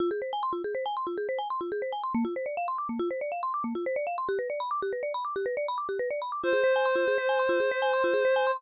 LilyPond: <<
  \new Staff \with { instrumentName = "Clarinet" } { \time 5/4 \key f \dorian \tempo 4 = 140 r1 r4 | r1 r4 | r1 r4 | c''1~ c''4 | }
  \new Staff \with { instrumentName = "Marimba" } { \time 5/4 \key f \dorian f'16 aes'16 c''16 aes''16 c'''16 f'16 aes'16 c''16 aes''16 c'''16 f'16 aes'16 c''16 aes''16 c'''16 f'16 aes'16 c''16 aes''16 c'''16 | bes16 f'16 c''16 d''16 f''16 c'''16 d'''16 bes16 f'16 c''16 d''16 f''16 c'''16 d'''16 bes16 f'16 c''16 d''16 f''16 c'''16 | g'16 b'16 d''16 b''16 d'''16 g'16 b'16 d''16 b''16 d'''16 g'16 b'16 d''16 b''16 d'''16 g'16 b'16 d''16 b''16 d'''16 | f'16 aes'16 c''16 aes''16 c'''16 f'16 aes'16 c''16 aes''16 c'''16 f'16 aes'16 c''16 aes''16 c'''16 f'16 aes'16 c''16 aes''16 c'''16 | }
>>